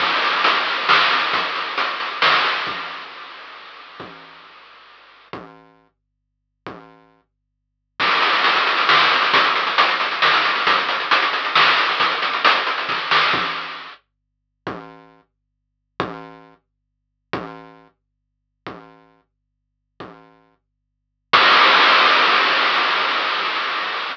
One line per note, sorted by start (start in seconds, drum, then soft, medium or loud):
0.00 kick medium
0.00 crash medium
0.22 closed hi-hat medium
0.44 closed hi-hat medium
0.67 closed hi-hat soft
0.89 snare medium
1.11 closed hi-hat soft
1.33 kick medium
1.33 closed hi-hat medium
1.55 closed hi-hat soft
1.78 closed hi-hat medium
2.00 closed hi-hat medium
2.22 snare medium
2.44 closed hi-hat soft
2.67 kick medium
4.00 kick medium
5.33 kick medium
6.67 kick medium
8.00 kick medium
8.00 crash medium
8.11 closed hi-hat medium
8.22 closed hi-hat medium
8.33 closed hi-hat medium
8.44 closed hi-hat medium
8.55 closed hi-hat medium
8.67 closed hi-hat medium
8.78 closed hi-hat medium
8.89 snare medium
9.00 closed hi-hat medium
9.11 closed hi-hat medium
9.22 closed hi-hat medium
9.34 kick medium
9.34 closed hi-hat medium
9.44 closed hi-hat medium
9.56 closed hi-hat medium
9.67 closed hi-hat medium
9.78 closed hi-hat medium
9.89 closed hi-hat medium
10.00 closed hi-hat medium
10.11 closed hi-hat medium
10.22 snare medium
10.33 closed hi-hat medium
10.44 closed hi-hat medium
10.56 closed hi-hat medium
10.67 kick medium
10.67 closed hi-hat medium
10.78 closed hi-hat medium
10.89 closed hi-hat medium
11.00 closed hi-hat medium
11.11 closed hi-hat medium
11.22 closed hi-hat medium
11.33 closed hi-hat medium
11.45 closed hi-hat medium
11.55 snare medium
11.67 closed hi-hat medium
11.78 closed hi-hat medium
11.89 closed hi-hat medium
12.00 kick medium
12.00 closed hi-hat medium
12.11 closed hi-hat medium
12.22 closed hi-hat medium
12.33 closed hi-hat medium
12.45 closed hi-hat medium
12.55 closed hi-hat medium
12.67 closed hi-hat medium
12.78 closed hi-hat medium
12.89 kick medium
12.89 snare medium
13.11 snare medium
13.33 kick loud
14.67 kick loud
16.00 kick loud
17.33 kick loud
18.67 kick medium
20.00 kick medium
21.33 kick loud
21.33 crash loud